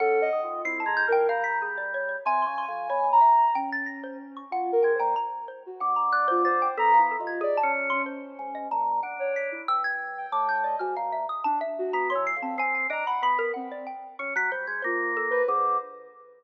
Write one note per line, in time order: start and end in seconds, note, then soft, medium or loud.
0.00 0.29 C#4 medium
0.00 0.19 A4 medium
0.00 0.58 F#5 loud
0.22 0.41 D#5 loud
0.33 0.62 D#3 medium
0.43 0.62 F4 medium
0.65 0.84 C4 medium
0.65 0.84 E4 medium
0.65 0.80 C7 loud
0.80 0.94 A5 medium
0.86 1.05 G#3 medium
0.86 1.05 A#5 medium
0.97 1.11 G6 loud
1.08 1.27 F3 medium
1.08 1.27 A#4 loud
1.12 1.27 G5 loud
1.28 2.16 G3 medium
1.28 1.44 F5 loud
1.28 1.57 A#5 medium
1.44 1.58 B6 medium
1.62 1.76 G#4 medium
1.78 1.92 D5 medium
1.94 2.08 C#5 medium
2.09 2.23 C#5 medium
2.25 2.45 C3 loud
2.25 2.64 G#5 loud
2.25 2.41 G#5 loud
2.42 2.57 C6 medium
2.47 2.66 C#3 medium
2.58 2.87 C6 medium
2.68 2.88 F2 medium
2.68 3.07 G#5 medium
2.90 3.19 B2 medium
2.90 3.19 C#5 medium
3.12 3.51 A#5 medium
3.21 3.50 E5 medium
3.55 4.42 C#4 medium
3.55 3.70 G5 loud
3.72 3.87 A6 medium
3.86 4.01 A#6 medium
4.03 4.18 C5 medium
4.37 4.51 C#6 soft
4.51 4.70 F4 medium
4.51 4.81 F#5 loud
4.72 4.92 A#4 medium
4.83 4.99 G#3 medium
4.83 4.97 G5 medium
4.95 5.14 C5 medium
4.99 5.15 A#2 loud
4.99 5.14 G5 medium
5.16 5.45 A#5 medium
5.48 5.63 C5 medium
5.66 5.81 F#4 medium
5.80 6.68 D3 medium
5.80 5.95 F#5 soft
5.96 6.11 A#5 medium
6.12 6.26 D5 medium
6.12 6.27 F#6 loud
6.28 6.45 F4 medium
6.28 6.42 C5 loud
6.45 6.74 C5 medium
6.45 6.59 A6 medium
6.62 6.76 G5 medium
6.78 7.16 B3 medium
6.78 6.92 A4 loud
6.78 6.98 A#5 loud
6.94 7.08 F5 soft
6.98 7.17 E4 medium
7.11 7.26 A4 medium
7.19 7.59 D#2 medium
7.19 7.38 F4 medium
7.27 7.42 G#6 medium
7.41 7.56 G#4 loud
7.41 7.58 D5 medium
7.57 7.72 A5 loud
7.63 8.02 C#4 loud
7.90 8.64 C#4 medium
7.90 8.04 C6 medium
8.06 8.50 C5 medium
8.39 8.68 G#2 medium
8.55 8.69 D#5 medium
8.71 9.00 A#2 medium
8.71 9.01 A5 medium
9.03 9.61 D4 medium
9.03 9.32 F#5 medium
9.19 9.48 C#5 medium
9.36 9.65 B6 medium
9.52 9.66 E4 medium
9.68 10.26 G2 medium
9.68 9.83 E6 loud
9.84 10.28 G#6 loud
10.18 10.61 G5 medium
10.32 10.76 A2 medium
10.32 10.47 D6 medium
10.49 10.63 G6 medium
10.64 10.78 D5 medium
10.64 10.79 D#5 medium
10.79 10.95 G#2 medium
10.79 10.94 F#4 medium
10.79 10.94 F6 soft
10.97 11.26 A#2 medium
10.97 11.11 F5 medium
11.12 11.27 E5 medium
11.29 11.44 D#6 medium
11.44 11.59 D4 loud
11.44 11.59 A5 loud
11.61 11.90 E5 medium
11.79 12.08 F#4 medium
11.93 12.13 B3 medium
11.93 12.08 A#5 medium
12.10 12.25 C#5 medium
12.10 12.24 C6 medium
12.15 12.35 E3 medium
12.27 12.41 C7 loud
12.37 12.56 F2 medium
12.42 12.56 C4 loud
12.42 12.57 A5 medium
12.58 12.87 C4 loud
12.58 12.74 G#5 loud
12.75 12.89 G#5 medium
12.90 13.04 D4 medium
12.90 13.05 D#5 loud
12.90 13.06 A#5 medium
13.06 13.21 F#5 medium
13.06 13.22 B5 medium
13.22 13.51 B3 medium
13.22 13.37 B5 loud
13.39 13.53 A#4 loud
13.54 13.85 C4 medium
13.54 13.68 F#5 medium
13.72 13.86 D5 medium
13.87 14.16 G5 medium
14.19 14.34 C#4 medium
14.19 14.34 C#6 medium
14.36 14.50 F#3 loud
14.36 14.51 B6 loud
14.51 14.66 G3 medium
14.51 14.66 C5 medium
14.67 14.82 G#3 medium
14.67 14.82 G6 soft
14.82 15.42 A#3 loud
14.82 15.14 F4 medium
14.82 15.11 C5 medium
15.17 15.31 A4 medium
15.31 15.45 B4 loud
15.31 15.46 C5 medium
15.47 15.77 D3 loud
15.47 15.77 G#4 medium
15.47 15.76 C5 medium